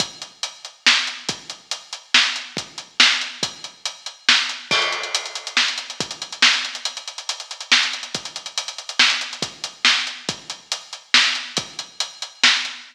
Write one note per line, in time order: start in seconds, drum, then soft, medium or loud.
0.00 kick loud
0.00 closed hi-hat loud
0.22 closed hi-hat medium
0.43 closed hi-hat loud
0.65 closed hi-hat medium
0.86 snare loud
1.07 closed hi-hat medium
1.29 kick loud
1.29 closed hi-hat loud
1.50 closed hi-hat medium
1.71 closed hi-hat loud
1.93 closed hi-hat medium
2.14 snare loud
2.36 closed hi-hat medium
2.57 kick loud
2.57 closed hi-hat medium
2.78 closed hi-hat medium
3.00 snare loud
3.21 closed hi-hat medium
3.43 kick loud
3.43 closed hi-hat loud
3.64 closed hi-hat medium
3.85 closed hi-hat loud
4.06 closed hi-hat medium
4.29 snare loud
4.49 closed hi-hat medium
4.71 kick loud
4.71 crash loud
4.82 closed hi-hat medium
4.92 closed hi-hat medium
5.03 closed hi-hat medium
5.15 closed hi-hat loud
5.26 closed hi-hat medium
5.35 closed hi-hat medium
5.47 closed hi-hat medium
5.57 snare loud
5.68 closed hi-hat medium
5.78 closed hi-hat medium
5.90 closed hi-hat medium
6.00 kick loud
6.00 closed hi-hat loud
6.11 closed hi-hat medium
6.22 closed hi-hat medium
6.32 closed hi-hat medium
6.42 snare loud
6.53 closed hi-hat medium
6.65 closed hi-hat medium
6.75 closed hi-hat medium
6.85 closed hi-hat loud
6.97 closed hi-hat medium
7.08 closed hi-hat medium
7.18 closed hi-hat medium
7.29 closed hi-hat loud
7.40 closed hi-hat medium
7.51 closed hi-hat medium
7.61 closed hi-hat medium
7.72 snare loud
7.83 closed hi-hat medium
7.93 closed hi-hat medium
8.03 closed hi-hat medium
8.15 kick loud
8.15 closed hi-hat medium
8.25 closed hi-hat medium
8.36 closed hi-hat medium
8.46 closed hi-hat medium
8.58 closed hi-hat loud
8.68 closed hi-hat medium
8.78 closed hi-hat medium
8.89 closed hi-hat medium
8.99 snare loud
9.10 closed hi-hat medium
9.21 closed hi-hat medium
9.33 closed hi-hat medium
9.42 kick loud
9.42 closed hi-hat loud
9.64 closed hi-hat medium
9.85 snare loud
10.07 closed hi-hat medium
10.29 kick loud
10.29 closed hi-hat loud
10.50 closed hi-hat medium
10.72 closed hi-hat loud
10.93 closed hi-hat medium
11.14 snare loud
11.35 closed hi-hat medium
11.57 kick loud
11.57 closed hi-hat loud
11.79 closed hi-hat medium
12.00 closed hi-hat loud
12.22 closed hi-hat medium
12.43 snare loud
12.65 closed hi-hat medium